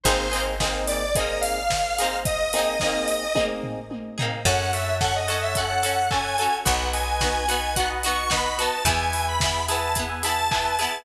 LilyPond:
<<
  \new Staff \with { instrumentName = "Lead 1 (square)" } { \time 4/4 \key ees \major \tempo 4 = 109 c''8. r8. d''8 ees''8 f''4. | ees''2~ ees''8 r4. | \key e \major fis''8 e''8 fis''16 dis''16 dis''16 e''16 fis''4 gis''4 | fis''8 gis''4. fis''16 r16 cis'''8 b''16 b''16 a''8 |
gis''8. b''8. a''8 r8 a''4. | }
  \new Staff \with { instrumentName = "Electric Piano 1" } { \time 4/4 \key ees \major <bes c' ees' aes'>8 <bes c' ees' aes'>8 <bes c' ees' aes'>4 <bes c' ees' aes'>2~ | <bes c' ees' aes'>8 <bes c' ees' aes'>8 <bes c' ees' aes'>4 <bes c' ees' aes'>2 | \key e \major <cis'' fis'' a''>8 <cis'' fis'' a''>4 <cis'' fis'' a''>8. <cis'' fis'' a''>8. <cis'' fis'' a''>16 <cis'' fis'' a''>16 <cis'' fis'' a''>8 | <b' dis'' fis''>8 <b' dis'' fis''>4 <b' dis'' fis''>8. <b' dis'' fis''>8. <b' dis'' fis''>16 <b' dis'' fis''>16 <b' dis'' fis''>8 |
<b' e'' gis''>8 <b' e'' gis''>4 <b' e'' gis''>8. <b' e'' gis''>8. <b' e'' gis''>16 <b' e'' gis''>16 <b' e'' gis''>8 | }
  \new Staff \with { instrumentName = "Acoustic Guitar (steel)" } { \time 4/4 \key ees \major <bes c' ees' aes'>8 <bes c' ees' aes'>8 <bes c' ees' aes'>4 <bes c' ees' aes'>4. <bes c' ees' aes'>8~ | <bes c' ees' aes'>8 <bes c' ees' aes'>8 <bes c' ees' aes'>4 <bes c' ees' aes'>4. <bes c' ees' aes'>8 | \key e \major <cis' fis' a'>4 <cis' fis' a'>8 <cis' fis' a'>8 <cis' fis' a'>8 <cis' fis' a'>8 <cis' fis' a'>8 <cis' fis' a'>8 | <b dis' fis'>4 <b dis' fis'>8 <b dis' fis'>8 <b dis' fis'>8 <b dis' fis'>8 <b dis' fis'>8 <b dis' fis'>8 |
<b e' gis'>4 <b e' gis'>8 <b e' gis'>8 <b e' gis'>8 <b e' gis'>8 <b e' gis'>8 <b e' gis'>8 | }
  \new Staff \with { instrumentName = "Electric Bass (finger)" } { \clef bass \time 4/4 \key ees \major aes,,1~ | aes,,1 | \key e \major fis,1 | b,,1 |
e,1 | }
  \new DrumStaff \with { instrumentName = "Drums" } \drummode { \time 4/4 <hh bd>8 hho8 <bd sn>8 hho8 <hh bd>8 hho8 <bd sn>8 hho8 | <hh bd>8 hho8 <bd sn>8 hho8 <bd tommh>8 tomfh8 tommh8 tomfh8 | <cymc bd>8 hho8 <bd sn>8 hho8 <hh bd>8 hho8 <hc bd>8 hho8 | <hh bd>8 hho8 <bd sn>8 hho8 <hh bd>8 hho8 <bd sn>8 hho8 |
<hh bd>8 hho8 <bd sn>8 hho8 <hh bd>8 hho8 <hc bd>8 hho8 | }
>>